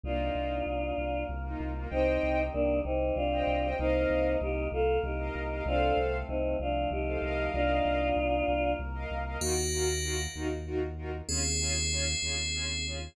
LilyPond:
<<
  \new Staff \with { instrumentName = "Choir Aahs" } { \time 6/8 \key c \dorian \tempo 4. = 64 <d' f'>2 r4 | <c' ees'>4 <bes d'>8 <c' ees'>8 <d' f'>4 | <c' ees'>4 <ees' g'>8 <f' a'>8 <ees' g'>4 | <d' f'>8 r8 <c' ees'>8 <d' f'>8 <ees' g'>4 |
<d' f'>2 r4 | \key ees \dorian r2. | r2. | }
  \new Staff \with { instrumentName = "Tubular Bells" } { \time 6/8 \key c \dorian r2. | r2. | r2. | r2. |
r2. | \key ees \dorian <bes ges'>4. r4. | <c' aes'>2. | }
  \new Staff \with { instrumentName = "String Ensemble 1" } { \time 6/8 \key c \dorian <bes ees' f'>2~ <bes ees' f'>16 <bes ees' f'>8 <bes ees' f'>16 | <c'' ees'' g''>2~ <c'' ees'' g''>16 <c'' ees'' g''>8 <c'' ees'' g''>16 | <bes' ees'' f''>2~ <bes' ees'' f''>16 <bes' ees'' f''>8 <bes' ees'' f''>16 | <a' c'' f''>2~ <a' c'' f''>16 <a' c'' f''>16 <bes' ees'' f''>8~ |
<bes' ees'' f''>2~ <bes' ees'' f''>16 <bes' ees'' f''>8 <bes' ees'' f''>16 | \key ees \dorian <ees' f' ges' bes'>8 <ees' f' ges' bes'>8 <ees' f' ges' bes'>8 <ees' f' ges' bes'>8 <ees' f' ges' bes'>8 <ees' f' ges' bes'>8 | <des' f' aes'>8 <des' f' aes'>8 <des' f' aes'>8 <des' f' aes'>8 <des' f' aes'>8 <des' f' aes'>8 | }
  \new Staff \with { instrumentName = "Synth Bass 2" } { \clef bass \time 6/8 \key c \dorian c,8 c,8 c,8 c,8 c,8 c,8 | c,8 c,8 c,8 c,8 c,8 c,8 | c,8 c,8 c,8 c,8 c,8 c,8 | c,8 c,8 c,8 c,8 c,8 c,8 |
c,8 c,8 c,8 c,8 c,8 c,8 | \key ees \dorian ees,4. ees,4. | ees,4. ees,4. | }
  \new Staff \with { instrumentName = "Choir Aahs" } { \time 6/8 \key c \dorian <bes ees' f'>4. <bes f' bes'>4. | <c' ees' g'>4. <g c' g'>4. | <bes ees' f'>4. <bes f' bes'>4. | <a c' f'>4. <f a f'>4. |
<bes ees' f'>4. <bes f' bes'>4. | \key ees \dorian r2. | r2. | }
>>